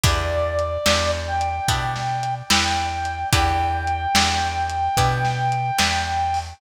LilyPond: <<
  \new Staff \with { instrumentName = "Brass Section" } { \time 4/4 \key e \minor \tempo 4 = 73 d''4. g''4. g''4 | g''1 | }
  \new Staff \with { instrumentName = "Acoustic Guitar (steel)" } { \time 4/4 \key e \minor <b d' e' g'>4 <b d' e' g'>4 <b d' e' g'>4 <b d' e' g'>4 | <b d' e' g'>4 <b d' e' g'>4 <b d' e' g'>4 <b d' e' g'>4 | }
  \new Staff \with { instrumentName = "Electric Bass (finger)" } { \clef bass \time 4/4 \key e \minor e,4 e,4 b,4 e,4 | e,4 e,4 b,4 e,4 | }
  \new DrumStaff \with { instrumentName = "Drums" } \drummode { \time 4/4 \tuplet 3/2 { <hh bd>8 r8 hh8 sn8 r8 hh8 <hh bd>8 sn8 hh8 sn8 r8 hh8 } | \tuplet 3/2 { <hh bd>8 r8 hh8 sn8 r8 hh8 <hh bd>8 sn8 hh8 sn8 r8 hho8 } | }
>>